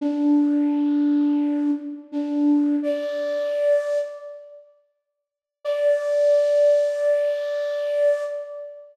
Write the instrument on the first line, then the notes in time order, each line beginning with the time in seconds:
flute
0.01 D4
2.12 D4
2.82 D5
5.65 D5